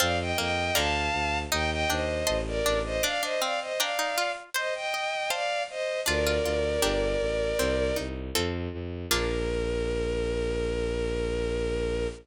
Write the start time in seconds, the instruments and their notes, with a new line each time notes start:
0.00 violin F2 D5 F5, harpsichord C4 C5 F5 A5
0.19 violin D#5 G5
0.38 violin F2 D#5 G5, harpsichord A#3
0.75 violin D2 F5 A5, harpsichord D3 D5 F5 A#5
1.13 violin D2
1.52 violin D#2 D#5 G5, harpsichord D#4 D#5
1.71 violin D#5 G5
1.89 violin D#2 C5 D#5, harpsichord D4 G5
2.27 violin A1, harpsichord D#5 A5 C6
2.47 violin A#4 D5
2.66 violin A1, harpsichord D4
2.85 violin C5 D#5
3.03 harpsichord D4 D5, violin D5 F5
3.23 harpsichord D4, violin C5 D#5
3.41 harpsichord C4 F5, violin D5 F5
3.61 violin C5 D#5
3.79 harpsichord D4 D5 G5 A#5, violin D5 F5
3.99 harpsichord D#4
4.18 harpsichord F4
4.54 harpsichord C5, violin C5 D#5
4.75 violin D#5 G5
4.94 harpsichord D#5
5.30 harpsichord C5 F5 A5, violin D5 F5
5.70 violin C5 D#5
6.06 violin D2 A#4 D5, harpsichord D4 F4
6.27 harpsichord F4
6.45 violin D2, harpsichord F4
6.82 violin G1, harpsichord D4 G4 A#4
7.21 violin A1
7.59 violin C2, harpsichord C4
7.96 violin C2, harpsichord D#4
8.35 violin F2, harpsichord C4 F4 A4
8.73 violin F2
9.10 violin A#1 A#4, harpsichord A#3 D4 F4 A#4